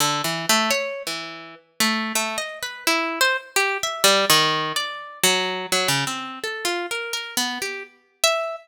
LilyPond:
\new Staff { \time 4/4 \tempo 4 = 84 \tuplet 3/2 { d8 e8 a8 } cis''8 e8. r16 a8 \tuplet 3/2 { a8 dis''8 b'8 } | e'8 c''16 r16 \tuplet 3/2 { g'8 e''8 g8 dis4 d''4 fis4 } | fis16 cis16 c'8 \tuplet 3/2 { a'8 f'8 ais'8 ais'8 b8 g'8 } r8 e''8 | }